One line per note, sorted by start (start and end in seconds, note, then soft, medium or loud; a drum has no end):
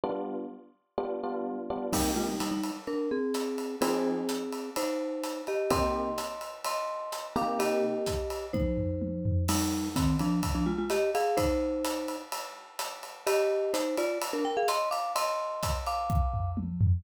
0.04 0.37 G3 medium
0.04 0.37 B3 medium
0.04 0.37 D4 medium
0.04 0.37 F4 medium
0.98 1.14 G3 medium
0.98 1.14 B3 medium
0.98 1.14 D4 medium
0.98 1.14 F4 medium
1.23 1.56 G3 medium
1.23 1.56 B3 medium
1.23 1.56 D4 medium
1.23 1.56 F4 medium
1.70 1.87 G3 medium
1.70 1.87 B3 medium
1.70 1.87 D4 medium
1.70 1.87 F4 medium
1.93 2.26 C3 medium
1.93 2.12 G3 medium
1.93 2.26 A#3 medium
1.93 2.12 D#4 medium
1.93 2.26 D#4 medium
1.93 2.26 G4 medium
1.93 kick medium
1.93 crash loud
1.93 ride medium
2.16 2.27 G#3 medium
2.16 2.27 F4 medium
2.29 2.40 G3 medium
2.29 2.40 D#4 medium
2.40 2.51 G3 medium
2.40 2.51 D#4 medium
2.40 hi-hat pedal medium
2.40 ride medium
2.51 2.71 G3 medium
2.51 2.71 D#4 medium
2.63 ride medium
2.87 3.09 D4 medium
2.87 3.09 A#4 medium
2.87 ride soft
3.11 3.76 C4 medium
3.11 3.76 G#4 medium
3.34 hi-hat pedal medium
3.34 ride medium
3.58 ride medium
3.81 4.15 F3 medium
3.81 4.70 C4 medium
3.81 4.15 C4 medium
3.81 4.15 D#4 medium
3.81 4.70 G#4 medium
3.81 4.15 G#4 medium
3.81 ride loud
4.29 hi-hat pedal medium
4.29 ride medium
4.52 ride medium
4.76 5.42 D#4 medium
4.76 5.42 C5 medium
4.76 ride medium
5.24 hi-hat pedal medium
5.24 ride medium
5.47 5.71 G4 medium
5.47 5.71 D#5 medium
5.47 ride medium
5.70 6.04 C3 medium
5.70 6.04 A#3 medium
5.70 6.04 D#4 medium
5.70 6.04 G4 medium
5.70 6.55 D#5 medium
5.70 6.55 C6 medium
5.70 kick medium
5.70 ride medium
6.18 hi-hat pedal medium
6.18 ride medium
6.41 ride medium
6.64 7.27 D#5 medium
6.64 7.27 C6 medium
6.64 ride medium
7.12 hi-hat pedal medium
7.12 ride medium
7.36 7.92 C3 medium
7.36 7.92 A#3 medium
7.36 7.92 D#4 medium
7.36 7.92 G4 medium
7.36 7.60 F5 medium
7.36 7.60 D6 medium
7.36 ride medium
7.59 8.46 G4 medium
7.59 8.46 D#5 medium
7.59 ride medium
8.06 kick medium
8.06 hi-hat pedal medium
8.06 ride medium
8.30 ride medium
8.53 9.45 D#4 medium
8.53 9.45 C5 medium
8.53 kick medium
8.53 high tom medium
8.77 floor tom medium
9.02 high tom medium
9.25 floor tom loud
9.48 9.89 G3 medium
9.48 9.89 D#4 loud
9.48 crash medium
9.48 ride loud
9.96 10.16 D#3 medium
9.96 10.16 C4 medium
9.96 kick medium
9.96 hi-hat pedal medium
9.96 ride medium
10.19 10.41 F3 medium
10.19 10.41 D4 medium
10.19 ride medium
10.43 kick medium
10.43 ride medium
10.55 10.66 F3 medium
10.55 10.66 D4 medium
10.66 10.77 G#3 medium
10.66 10.77 F4 medium
10.78 10.90 G#3 medium
10.78 10.90 F4 medium
10.90 11.10 G4 medium
10.90 11.10 D#5 medium
10.90 hi-hat pedal medium
10.90 ride medium
11.15 11.38 G#4 medium
11.15 11.38 F5 medium
11.15 ride medium
11.37 12.16 D#4 medium
11.37 12.16 C5 loud
11.37 kick medium
11.37 ride medium
11.85 hi-hat pedal medium
11.85 ride medium
12.08 ride medium
12.32 ride medium
12.79 hi-hat pedal medium
12.79 ride medium
13.03 ride medium
13.27 13.72 G4 medium
13.27 13.72 D#5 loud
13.27 ride loud
13.74 13.96 D#4 medium
13.74 13.96 C5 medium
13.74 hi-hat pedal medium
13.74 ride medium
13.97 14.18 F4 medium
13.97 14.18 D5 medium
13.97 ride medium
14.22 ride loud
14.33 14.44 D4 medium
14.33 14.44 A#4 medium
14.45 14.56 A#4 medium
14.45 14.56 G5 medium
14.57 14.68 G#4 medium
14.57 14.68 F5 medium
14.68 14.89 D#5 medium
14.68 14.89 C6 medium
14.68 hi-hat pedal medium
14.68 ride medium
14.91 15.13 F5 medium
14.91 15.13 D6 medium
14.91 ride medium
15.16 15.78 D#5 medium
15.16 15.78 C6 medium
15.16 ride loud
15.63 kick medium
15.63 hi-hat pedal medium
15.63 ride medium
15.87 16.51 F5 medium
15.87 16.51 D6 medium
15.87 ride medium
16.10 kick medium
16.34 floor tom medium
16.57 high tom medium
16.81 floor tom loud